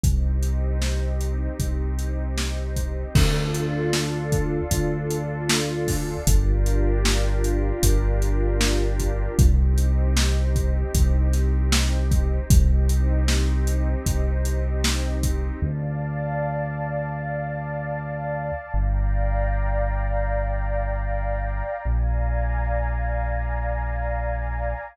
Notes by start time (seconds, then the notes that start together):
0.04 C2 C4 D#4 G4, kick, closed hi-hat
0.43 closed hi-hat
0.82 snare
1.21 closed hi-hat
1.59 C2, kick, closed hi-hat
1.99 closed hi-hat
2.38 snare
2.76 kick, closed hi-hat
3.15 D2 D4 F4 A4, kick, crash
3.54 closed hi-hat
3.93 snare
4.32 kick, closed hi-hat
4.71 D2, kick, closed hi-hat
5.11 closed hi-hat
5.50 snare
5.88 kick, snare, open hi-hat
6.27 G1 D4 F4 G4 A#4, kick, closed hi-hat
6.66 closed hi-hat
7.05 snare
7.44 closed hi-hat
7.83 G1, kick, closed hi-hat
8.22 closed hi-hat
8.61 snare
9.00 kick, closed hi-hat
9.38 C2 C4 D#4 G4, kick, closed hi-hat
9.78 closed hi-hat
10.17 snare
10.56 kick, closed hi-hat
10.94 C2, kick, closed hi-hat
11.33 snare, closed hi-hat
11.72 snare
12.11 kick, closed hi-hat
12.50 C2 C4 D#4 G4, kick, closed hi-hat
12.89 closed hi-hat
13.28 snare
13.67 closed hi-hat
14.06 C2, kick, closed hi-hat
14.45 closed hi-hat
14.84 snare
15.23 kick, closed hi-hat
15.62 D2 D5 F5 A5
18.74 G1 D5 F5 G5 A#5
21.85 A#1 D5 F5 G#5 A#5